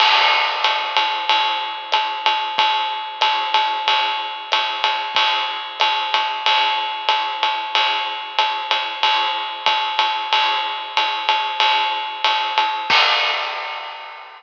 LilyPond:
\new DrumStaff \drummode { \time 4/4 \tempo 4 = 93 <cymc cymr>4 <hhp cymr>8 cymr8 cymr4 <hhp cymr>8 cymr8 | <bd cymr>4 <hhp cymr>8 cymr8 cymr4 <hhp cymr>8 cymr8 | <bd cymr>4 <hhp cymr>8 cymr8 cymr4 <hhp cymr>8 cymr8 | cymr4 <hhp cymr>8 cymr8 <bd cymr>4 <hhp bd cymr>8 cymr8 |
cymr4 <hhp cymr>8 cymr8 cymr4 <hhp cymr>8 cymr8 | <cymc bd>4 r4 r4 r4 | }